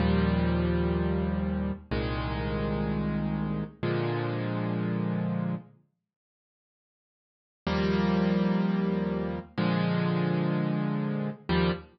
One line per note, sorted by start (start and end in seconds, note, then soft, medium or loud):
0.00 1.72 D#2 loud
0.00 1.72 A#2 medium
0.00 1.72 F3 medium
0.00 1.72 G3 medium
1.91 3.64 C2 medium
1.91 3.64 A#2 medium
1.91 3.64 D#3 medium
1.91 3.64 G#3 medium
3.83 5.55 A#2 medium
3.83 5.55 D3 medium
3.83 5.55 F3 medium
3.83 5.55 G#3 medium
7.67 9.39 D#2 loud
7.67 9.39 F3 medium
7.67 9.39 G3 loud
7.67 9.39 A#3 medium
9.58 11.30 A#2 medium
9.58 11.30 D3 medium
9.58 11.30 F3 medium
9.58 11.30 G#3 loud
11.49 11.72 D#2 loud
11.49 11.72 A#2 loud
11.49 11.72 F3 medium
11.49 11.72 G3 loud